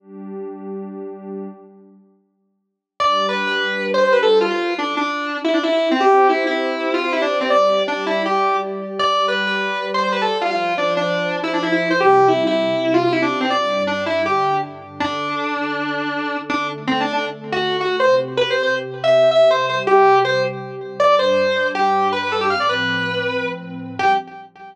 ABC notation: X:1
M:4/4
L:1/16
Q:1/4=160
K:Gmix
V:1 name="Distortion Guitar"
z16 | z16 | d3 B2 B5 c c B A2 F | F3 D2 D5 E D E E2 C |
G3 E2 E5 F F E D2 C | d4 D2 E2 G4 z4 | d3 B2 B5 c c B A2 F | F3 D2 D5 E D E E2 c |
G3 E2 E5 F F E D2 C | d4 D2 E2 G4 z4 | [K:Dmix] D16 | D2 z2 (3C2 D2 D2 z3 F3 F2 |
c2 z2 (3B2 c2 c2 z3 e3 e2 | c2 c z G4 c2 z6 | [K:Gmix] d2 c6 G4 B B A G | f d B10 z4 |
G4 z12 |]
V:2 name="Pad 2 (warm)"
[G,DG]16 | z16 | [G,DG]16 | z16 |
[CGc]16 | [G,Gd]16 | [G,Gd]16 | [F,Fc]16 |
[C,G,C]8 [C,CG]8 | [G,,G,D]8 [G,,D,D]8 | [K:Dmix] [D,DA]16 | [D,A,A]16 |
[C,CG]16 | [C,G,G]16 | [K:Gmix] [G,,G,D]16 | [A,,F,C]16 |
[G,DG]4 z12 |]